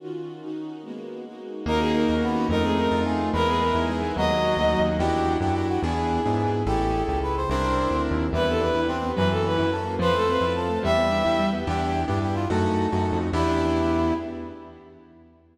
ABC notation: X:1
M:6/8
L:1/16
Q:3/8=144
K:D#phr
V:1 name="Violin"
z12 | z12 | A2 G2 A4 z4 | A2 G2 A4 z4 |
A2 G2 A4 z4 | d10 z2 | [K:Ephr] z12 | z12 |
z12 | z12 | B2 A2 B4 z4 | B2 A2 B4 z4 |
B2 A2 B4 z4 | e10 z2 | z12 | z12 |
z12 |]
V:2 name="Brass Section"
z12 | z12 | D8 B,4 | _E8 G4 |
B8 G4 | F,6 F,4 z2 | [K:Ephr] G6 G2 G2 ^F2 | ^G12 |
G6 G2 B2 c2 | c8 z4 | E8 C4 | _F,8 A4 |
c8 A4 | G,6 G,4 z2 | G6 G2 G2 F2 | A12 |
E12 |]
V:3 name="Acoustic Grand Piano"
z12 | z12 | A,2 C2 D2 F2 A,2 C2 | =A,2 =C2 _E2 =F2 A,2 C2 |
G,2 B,2 D2 E2 G,2 B,2 | F,2 A,2 C2 D2 F,2 A,2 | [K:Ephr] [DE^FG]6 [DEFG]6 | [B,DE^G]6 [B,DEG]6 |
[^CE^GA]12 | [CDE_B]12 | G,2 B,2 D2 E2 D2 B,2 | _G,2 _B,2 _D2 _F2 D2 B,2 |
F,2 A,2 C2 E2 F,2 A,2 | G,2 B,2 D2 E2 G,2 B,2 | [B,DEG]6 [B,DEG]6 | [A,^C^D^F]6 [A,CDF]6 |
[B,DEG]12 |]
V:4 name="Synth Bass 1" clef=bass
z12 | z12 | D,,6 D,,6 | =F,,6 F,,6 |
E,,6 E,,6 | D,,6 =D,,3 ^D,,3 | [K:Ephr] E,,6 ^F,,6 | E,,6 ^G,,6 |
A,,,6 ^C,,6 | C,,6 D,,3 ^D,,3 | E,,6 E,,6 | _G,,6 G,,6 |
F,,6 F,,6 | E,,6 E,,6 | E,,6 G,,6 | ^F,,6 F,,3 =F,,3 |
E,,12 |]
V:5 name="String Ensemble 1"
[D,C^EF]6 [D,CDF]6 | [G,A,B,F]6 [G,A,DF]6 | [A,CDF]6 [A,CFA]6 | z12 |
[GBde]6 [GBeg]6 | [FAcd]6 [FAdf]6 | [K:Ephr] z12 | z12 |
z12 | z12 | [B,DEG]6 [B,DGB]6 | [_B,_D_F_G]6 [B,DG_B]6 |
[Acef]6 [Acfa]6 | [GBde]6 [GBeg]6 | z12 | z12 |
z12 |]